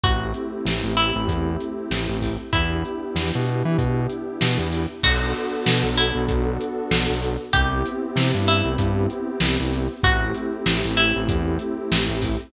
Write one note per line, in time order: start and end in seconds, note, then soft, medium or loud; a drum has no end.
0.04 0.33 A1 medium
0.04 2.29 A3 loud
0.04 2.29 C4 medium
0.04 2.29 E4 loud
0.04 0.90 F#4 medium
0.04 2.29 G4 medium
0.04 kick loud
0.04 closed hi-hat loud
0.34 closed hi-hat medium
0.65 0.82 A1 medium
0.65 snare loud
0.84 1.12 A1 medium
0.97 2.41 E4 medium
0.97 closed hi-hat medium
1.16 1.28 A1 medium
1.28 1.57 E2 medium
1.28 kick loud
1.28 closed hi-hat loud
1.60 closed hi-hat medium
1.91 2.07 A1 medium
1.91 snare loud
2.09 2.37 A1 medium
2.22 kick medium
2.22 open hi-hat medium
2.53 2.83 E2 medium
2.53 4.80 B3 medium
2.53 4.80 D4 medium
2.53 3.96 E4 medium
2.53 4.80 E4 loud
2.53 4.80 G4 loud
2.53 kick loud
2.53 closed hi-hat loud
2.85 closed hi-hat medium
3.15 3.31 E2 medium
3.15 snare loud
3.35 3.63 B2 medium
3.47 closed hi-hat medium
3.65 3.77 E3 medium
3.78 4.07 B2 medium
3.78 kick loud
3.78 closed hi-hat loud
4.10 closed hi-hat medium
4.41 4.58 B2 medium
4.41 snare loud
4.58 4.86 E2 medium
4.72 open hi-hat medium
5.03 5.33 B1 medium
5.03 7.29 B3 loud
5.03 7.29 D4 loud
5.03 7.29 F#4 loud
5.03 5.88 F#4 loud
5.03 7.29 A4 loud
5.03 kick loud
5.03 crash loud
5.35 closed hi-hat loud
5.66 5.83 B2 medium
5.66 snare loud
5.84 6.11 B1 medium
5.98 7.39 E4 medium
5.98 closed hi-hat medium
6.15 6.27 B1 medium
6.28 6.58 B1 medium
6.28 kick loud
6.28 closed hi-hat loud
6.61 closed hi-hat loud
6.91 7.07 B1 medium
6.91 snare loud
7.09 7.37 B1 medium
7.23 closed hi-hat loud
7.53 7.83 C2 medium
7.53 9.79 B3 loud
7.53 9.79 C4 loud
7.53 9.79 E4 loud
7.53 8.40 G4 loud
7.53 9.79 G4 loud
7.53 kick loud
7.53 closed hi-hat loud
7.86 closed hi-hat loud
8.16 8.32 C3 medium
8.16 snare loud
8.34 8.62 G2 medium
8.47 9.77 E4 medium
8.47 closed hi-hat loud
8.65 8.77 C2 medium
8.78 9.07 G2 medium
8.78 kick loud
8.78 closed hi-hat loud
9.10 closed hi-hat medium
9.40 9.57 C2 medium
9.40 snare loud
9.60 9.88 C2 medium
9.73 closed hi-hat loud
10.03 10.33 A1 medium
10.03 12.29 A3 loud
10.03 12.29 C4 loud
10.03 12.29 E4 loud
10.03 10.91 F#4 medium
10.03 12.29 G4 loud
10.03 kick loud
10.03 closed hi-hat loud
10.35 closed hi-hat medium
10.66 10.82 A1 medium
10.66 snare loud
10.85 11.12 A1 medium
10.97 12.41 E4 medium
10.97 closed hi-hat medium
11.16 11.28 A1 medium
11.29 11.58 E2 medium
11.29 kick loud
11.29 closed hi-hat loud
11.59 closed hi-hat loud
11.92 12.08 A1 medium
11.92 snare loud
12.09 12.37 A1 medium
12.22 kick loud
12.22 open hi-hat loud